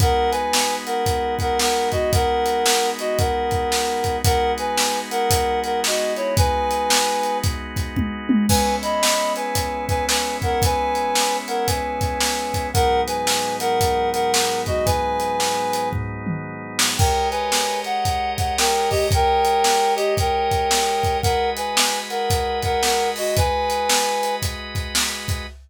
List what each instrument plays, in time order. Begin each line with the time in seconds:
0.00 drawbar organ G#3 B3 D#4 F#4, clarinet A#4 F#5, kick, closed hi-hat
0.31 clarinet B4 G#5, closed hi-hat
0.53 snare
0.86 clarinet A#4 F#5, closed hi-hat
1.06 kick, closed hi-hat
1.39 clarinet A#4 F#5, kick, closed hi-hat
1.59 clarinet A#4 F#5, snare
1.92 clarinet F#4 D#5, kick, closed hi-hat
2.13 clarinet A#4 F#5, kick, closed hi-hat
2.46 closed hi-hat
2.66 snare
2.99 clarinet F#4 D#5, closed hi-hat
3.18 clarinet A#4 F#5, kick, closed hi-hat
3.51 kick, closed hi-hat
3.72 snare
4.04 kick, closed hi-hat
4.24 drawbar organ G#3 B3 D#4 F#4, clarinet A#4 F#5, kick, closed hi-hat
4.58 clarinet B4 G#5, closed hi-hat
4.78 snare
5.11 clarinet A#4 F#5, closed hi-hat
5.30 kick, closed hi-hat
5.64 clarinet A#4 F#5, closed hi-hat
5.84 clarinet F#4 D#5, snare
6.16 clarinet E4 C#5, closed hi-hat
6.37 clarinet B4 G#5, kick, closed hi-hat
6.71 closed hi-hat
6.90 snare
7.23 closed hi-hat
7.43 kick, closed hi-hat
7.76 kick, closed hi-hat
7.96 kick, high tom
8.29 high tom
8.49 drawbar organ G#3 B3 C#4 E4, clarinet B4 G#5, kick, crash
8.82 clarinet D#5 B5, closed hi-hat
9.03 snare
9.36 clarinet B4 G#5, closed hi-hat
9.55 kick, closed hi-hat
9.88 clarinet B4 G#5, kick, closed hi-hat
10.09 clarinet B4 G#5, snare
10.42 clarinet A#4 F#5, kick, closed hi-hat
10.62 clarinet B4 G#5, kick, closed hi-hat
10.95 closed hi-hat
11.15 snare
11.48 clarinet A#4 F#5, closed hi-hat
11.67 clarinet B4 G#5, kick, closed hi-hat
12.01 kick, closed hi-hat
12.20 snare
12.54 kick, closed hi-hat
12.73 drawbar organ G#2 F#3 B3 D#4, clarinet A#4 F#5, kick, closed hi-hat
13.07 clarinet B4 G#5, closed hi-hat
13.27 snare
13.60 clarinet A#4 F#5, closed hi-hat
13.81 kick, closed hi-hat
14.13 clarinet A#4 F#5, closed hi-hat
14.33 clarinet A#4 F#5, snare
14.66 clarinet F#4 D#5, kick, closed hi-hat
14.85 clarinet B4 G#5, kick, closed hi-hat
15.20 closed hi-hat
15.40 snare
15.73 closed hi-hat
15.93 kick, floor tom
16.27 mid tom
16.79 snare
16.98 drawbar organ G#3 G4 A#4 C#5 D#5, clarinet A#4 G5, kick, crash
17.31 clarinet B4 G#5, closed hi-hat
17.52 snare
17.84 clarinet F#5, closed hi-hat
18.05 kick, closed hi-hat
18.37 clarinet F#5, kick, closed hi-hat
18.58 clarinet A#4 G5, snare
18.90 clarinet G4 D#5, kick, open hi-hat
19.11 clarinet A#4 G5, kick, closed hi-hat
19.45 closed hi-hat
19.64 snare
19.96 clarinet G4 D#5, closed hi-hat
20.17 clarinet A#4 G5, kick, closed hi-hat
20.51 kick, closed hi-hat
20.71 snare
21.03 kick, closed hi-hat
21.22 drawbar organ G#3 F#4 B4 D#5, clarinet A#4 F#5, kick, closed hi-hat
21.57 clarinet B4 G#5, closed hi-hat
21.77 snare
22.10 clarinet A#4 F#5, closed hi-hat
22.30 kick, closed hi-hat
22.62 clarinet A#4 F#5, kick, closed hi-hat
22.83 clarinet A#4 F#5, snare
23.16 clarinet F#4 D#5, open hi-hat
23.37 clarinet B4 G#5, kick, closed hi-hat
23.70 closed hi-hat
23.89 snare
24.23 closed hi-hat
24.42 kick, closed hi-hat
24.75 kick, closed hi-hat
24.95 snare
25.28 kick, closed hi-hat